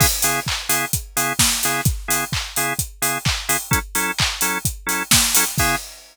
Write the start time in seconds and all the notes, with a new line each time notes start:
0.00 C#3 B3 E4 G#4, kick, crash
0.22 C#3 B3 E4 G#4, open hi-hat
0.47 kick, clap
0.69 C#3 B3 E4 G#4, open hi-hat
0.93 kick, closed hi-hat
1.17 C#3 B3 E4 G#4, open hi-hat
1.39 kick, snare
1.63 C#3 B3 E4 G#4, open hi-hat
1.85 kick, closed hi-hat
2.08 C#3 B3 E4 G#4, open hi-hat
2.32 kick, clap
2.56 C#3 B3 E4 G#4, open hi-hat
2.79 kick, closed hi-hat
3.02 C#3 B3 E4 G#4, open hi-hat
3.25 kick, clap
3.49 C#3 B3 E4 G#4, open hi-hat
3.71 F#3 C#4 E4 A4, kick, closed hi-hat
3.95 F#3 C#4 E4 A4, open hi-hat
4.19 kick, clap
4.41 F#3 C#4 E4 A4, open hi-hat
4.65 kick, closed hi-hat
4.87 F#3 C#4 E4 A4, open hi-hat
5.11 kick, snare
5.35 F#3 C#4 E4 A4, open hi-hat
5.58 C#3 B3 E4 G#4, kick, crash